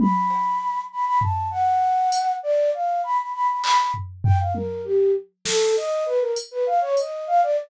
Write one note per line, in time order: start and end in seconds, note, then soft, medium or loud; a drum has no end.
0.00 0.81 B5 medium
0.00 high tom loud
0.30 cowbell medium
0.92 1.05 B5 medium
1.05 1.19 B5 loud
1.21 1.48 A5 medium
1.21 floor tom medium
1.51 2.33 F#5 loud
2.12 closed hi-hat medium
2.43 2.70 D5 loud
2.74 3.01 F5 medium
3.04 3.17 B5 medium
3.19 3.32 B5 medium
3.34 3.47 B5 medium
3.48 3.62 B5 medium
3.64 3.77 B5 loud
3.64 clap loud
3.78 3.92 B5 medium
3.94 floor tom medium
4.24 4.38 G5 loud
4.24 floor tom loud
4.40 4.53 F5 medium
4.54 4.81 A#4 medium
4.54 high tom medium
4.84 5.11 G4 medium
5.45 5.72 A4 loud
5.45 snare loud
5.77 6.04 D#5 loud
6.06 6.19 B4 loud
6.20 6.33 A#4 medium
6.36 closed hi-hat medium
6.51 6.65 B4 loud
6.66 6.80 F5 medium
6.81 6.95 C#5 loud
6.97 7.25 D#5 medium
6.97 closed hi-hat medium
7.27 7.41 F5 loud
7.43 7.56 D5 loud